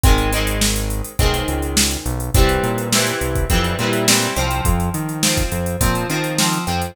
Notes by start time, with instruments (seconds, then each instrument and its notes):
0.03 synth bass 1 G#1, overdriven guitar D#3 G#3 C4, kick, closed hi-hat
0.18 closed hi-hat
0.32 overdriven guitar D#3 G#3 C4, closed hi-hat
0.47 closed hi-hat
0.61 snare
0.76 closed hi-hat
0.90 closed hi-hat
1.04 closed hi-hat
1.19 synth bass 1 B1, overdriven guitar D#3 G#3 C4, kick, closed hi-hat
1.34 closed hi-hat
1.48 synth bass 1 C#2, closed hi-hat
1.62 closed hi-hat
1.77 snare
1.91 closed hi-hat
2.06 synth bass 1 B1, closed hi-hat
2.20 closed hi-hat
2.34 synth bass 1 C2, overdriven guitar E3 G3 C4, kick, closed hi-hat
2.49 closed hi-hat
2.63 synth bass 1 A#2, closed hi-hat
2.78 closed hi-hat
2.92 overdriven guitar E3 G3 C4, snare
3.07 closed hi-hat
3.21 synth bass 1 C2, closed hi-hat
3.35 kick, closed hi-hat
3.50 synth bass 1 F2, overdriven guitar E3 G3 C4, kick, closed hi-hat
3.64 closed hi-hat
3.79 synth bass 1 A#2, overdriven guitar E3 G3 C4, closed hi-hat
3.93 closed hi-hat
4.08 overdriven guitar E3 G3 C4, snare
4.22 closed hi-hat
4.36 synth bass 1 C2, overdriven guitar F3 C4, closed hi-hat
4.51 closed hi-hat
4.65 synth bass 1 F2, kick, closed hi-hat
4.80 closed hi-hat
4.94 synth bass 1 D#3, closed hi-hat
5.09 closed hi-hat
5.23 overdriven guitar F3 C4, snare
5.37 kick, closed hi-hat
5.52 synth bass 1 F2, closed hi-hat
5.66 closed hi-hat
5.81 synth bass 1 A#2, overdriven guitar F3 C4, kick, closed hi-hat
5.95 closed hi-hat
6.09 synth bass 1 D#3, overdriven guitar F3 C4, closed hi-hat
6.24 closed hi-hat
6.38 overdriven guitar F3 C4, snare
6.53 closed hi-hat
6.67 synth bass 1 F2, overdriven guitar F3 C4, closed hi-hat
6.82 closed hi-hat